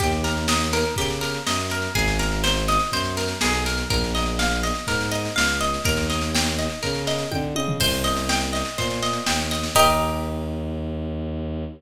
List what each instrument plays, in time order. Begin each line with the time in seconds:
0.00 violin D#2, pizzicato strings G4, kick, snare
0.12 snare
0.24 pizzicato strings A#4, snare
0.37 snare
0.48 pizzicato strings D#5, snare
0.60 snare
0.73 pizzicato strings A#4, snare
0.85 snare
0.96 violin C#3, pizzicato strings G4, kick, snare
1.10 snare
1.21 pizzicato strings A#4, snare
1.34 snare
1.46 violin F#2, pizzicato strings D#5, snare
1.60 snare
1.70 pizzicato strings A#4, snare
1.82 snare
1.94 violin G#1, pizzicato strings G#4, kick, snare
2.08 snare
2.19 pizzicato strings A#4, snare
2.32 snare
2.44 pizzicato strings C5, snare
2.57 snare
2.68 pizzicato strings D#5, snare
2.79 snare
2.92 violin F#2, pizzicato strings C5, kick, snare
3.05 snare
3.17 pizzicato strings A#4, snare
3.28 snare
3.41 violin B1, pizzicato strings G#4, snare
3.54 snare
3.66 pizzicato strings A#4, snare
3.78 snare
3.89 violin A#1, pizzicato strings A#4, kick, snare
4.04 snare
4.15 pizzicato strings D#5, snare
4.26 snare
4.39 pizzicato strings F5, snare
4.51 snare
4.63 pizzicato strings D#5, snare
4.75 snare
4.87 violin G#2, pizzicato strings A#4, kick, snare
5.00 snare
5.11 pizzicato strings D#5, snare
5.25 snare
5.36 violin C#2, pizzicato strings F5, snare
5.48 snare
5.60 pizzicato strings D#5, snare
5.74 snare
5.84 violin D#2, pizzicato strings A#4, kick, snare
5.97 snare
6.10 pizzicato strings D#5, snare
6.21 snare
6.35 pizzicato strings G5, snare
6.47 snare
6.59 pizzicato strings D#5, snare
6.70 snare
6.83 violin C#3, pizzicato strings A#4, kick, snare
6.95 snare
7.07 pizzicato strings D#5, snare
7.19 snare
7.31 violin D3, pizzicato strings G5, kick, high tom
7.55 violin C#3, pizzicato strings D#5, high tom
7.68 floor tom
7.79 violin C2, pizzicato strings C5, kick, snare, crash
7.93 snare
8.04 pizzicato strings D#5, snare
8.17 snare
8.29 pizzicato strings G5, snare
8.41 snare
8.53 pizzicato strings D#5, snare
8.65 snare
8.77 violin A#2, pizzicato strings C5, kick, snare
8.90 snare
9.03 pizzicato strings D#5, snare
9.13 snare
9.26 violin D#2, pizzicato strings G5, snare
9.39 snare
9.51 pizzicato strings D#5, snare
9.63 snare
9.75 violin D#2, pizzicato strings G4 A#4 D#5, kick, crash